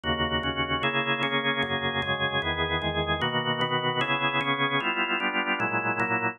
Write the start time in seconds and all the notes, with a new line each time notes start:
0.04 D#2 C#3 A#3 F#4
0.43 D#2 C#3 C#4 F#4
0.83 C#3 A#3 E4 G#4
1.23 C#3 A#3 C#4 G#4
1.62 F#2 C#3 A#3 G#4
2.02 F#2 C#3 G#3 G#4
2.42 E2 D#3 B3 G#4
2.82 E2 D#3 G#3 G#4
3.21 B2 D#3 A#3 F#4
3.61 B2 D#3 B3 F#4
4.01 C#3 B3 E4 G#4
4.41 C#3 B3 C#4 G#4
4.80 G3 B3 E4 F4
5.20 G3 B3 D4 F4
5.60 A#2 F#3 G#3 E4
6.00 A#2 F#3 A#3 E4